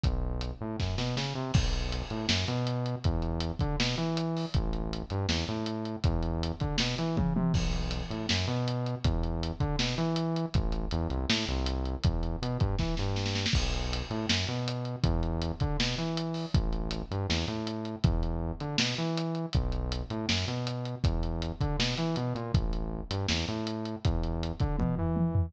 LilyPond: <<
  \new Staff \with { instrumentName = "Synth Bass 1" } { \clef bass \time 4/4 \key b \mixolydian \tempo 4 = 160 b,,4. a,8 fis,8 b,8 cis8 c8 | b,,4. a,8 fis,8 b,4. | e,4. d8 b,8 e4. | a,,4. g,8 e,8 a,4. |
e,4. d8 b,8 e8 cis8 c8 | b,,4. a,8 fis,8 b,4. | e,4. d8 b,8 e4. | a,,4 e,8 c,8 a,8 c,4. |
e,4 b,8 g,8 e8 g,4. | b,,4. a,8 fis,8 b,4. | e,4. d8 b,8 e4. | a,,4. g,8 e,8 a,4. |
e,4. d8 b,8 e4. | b,,4. a,8 fis,8 b,4. | e,4. d8 b,8 e8 b,8 ais,8 | a,,4. g,8 e,8 a,4. |
e,4. d8 b,8 e4. | }
  \new DrumStaff \with { instrumentName = "Drums" } \drummode { \time 4/4 <hh bd>4 hh4 <bd sn>8 sn8 sn4 | <cymc bd>8 hh8 hh8 hh8 sn8 hh8 hh8 hh8 | <hh bd>8 hh8 hh8 <hh bd>8 sn8 hh8 hh8 hho8 | <hh bd>8 hh8 hh8 hh8 sn8 hh8 hh8 hh8 |
<hh bd>8 hh8 hh8 <hh bd>8 sn8 hh8 <bd tommh>8 tommh8 | <cymc bd>8 hh8 hh8 hh8 sn8 hh8 hh8 hh8 | <hh bd>8 hh8 hh8 <hh bd>8 sn8 hh8 hh8 hh8 | <hh bd>8 hh8 hh8 hh8 sn8 hh8 hh8 hh8 |
<hh bd>8 hh8 hh8 <hh bd>8 <bd sn>8 sn8 sn16 sn16 sn16 sn16 | <cymc bd>8 hh8 hh8 hh8 sn8 hh8 hh8 hh8 | <hh bd>8 hh8 hh8 <hh bd>8 sn8 hh8 hh8 hho8 | <hh bd>8 hh8 hh8 hh8 sn8 hh8 hh8 hh8 |
<hh bd>8 hh8 r8 hh8 sn8 hh8 hh8 hh8 | <hh bd>8 hh8 hh8 hh8 sn8 hh8 hh8 hh8 | <hh bd>8 hh8 hh8 <hh bd>8 sn8 hh8 hh8 hh8 | <hh bd>8 hh8 r8 hh8 sn8 hh8 hh8 hh8 |
<hh bd>8 hh8 hh8 <hh bd>8 <bd tommh>8 tomfh8 tommh8 tomfh8 | }
>>